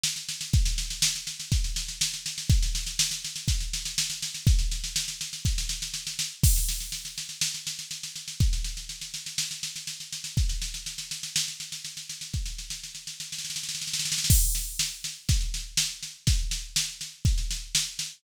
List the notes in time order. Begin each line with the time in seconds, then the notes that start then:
0.03 snare
0.16 snare
0.29 snare
0.41 snare
0.53 kick, snare
0.65 snare
0.78 snare
0.90 snare
1.02 snare
1.15 snare
1.27 snare
1.40 snare
1.52 kick, snare
1.64 snare
1.76 snare
1.88 snare
2.01 snare
2.14 snare
2.26 snare
2.38 snare
2.50 kick, snare
2.62 snare
2.75 snare
2.86 snare
2.99 snare
3.11 snare
3.24 snare
3.36 snare
3.48 kick, snare
3.60 snare
3.73 snare
3.85 snare
3.98 snare
4.10 snare
4.22 snare
4.34 snare
4.47 kick, snare
4.59 snare
4.71 snare
4.84 snare
4.96 snare
5.08 snare
5.21 snare
5.33 snare
5.45 kick, snare
5.58 snare
5.69 snare
5.82 snare
5.94 snare
6.07 snare
6.19 snare
6.43 kick, snare, crash
6.56 snare
6.69 snare
6.80 snare
6.92 snare
7.05 snare
7.18 snare
7.29 snare
7.41 snare
7.54 snare
7.67 snare
7.79 snare
7.91 snare
8.03 snare
8.16 snare
8.28 snare
8.40 kick, snare
8.53 snare
8.64 snare
8.77 snare
8.89 snare
9.01 snare
9.14 snare
9.26 snare
9.38 snare
9.51 snare
9.63 snare
9.76 snare
9.87 snare
10.00 snare
10.12 snare
10.24 snare
10.37 kick, snare
10.49 snare
10.62 snare
10.74 snare
10.86 snare
10.98 snare
11.11 snare
11.23 snare
11.36 snare
11.48 snare
11.60 snare
11.72 snare
11.85 snare
11.97 snare
12.09 snare
12.21 snare
12.34 kick, snare
12.46 snare
12.58 snare
12.70 snare
12.84 snare
12.95 snare
13.07 snare
13.20 snare
13.32 snare
13.39 snare
13.44 snare
13.50 snare
13.56 snare
13.63 snare
13.69 snare
13.75 snare
13.82 snare
13.87 snare
13.93 snare
13.99 snare
14.05 snare
14.12 snare
14.18 snare
14.24 snare
14.30 kick, snare, crash
14.55 snare
14.79 snare
15.04 snare
15.29 kick, snare
15.41 snare
15.54 snare
15.77 snare
15.90 snare
16.03 snare
16.27 kick, snare
16.39 snare
16.51 snare
16.76 snare
16.88 snare
17.01 snare
17.25 kick, snare
17.38 snare
17.51 snare
17.75 snare
17.99 snare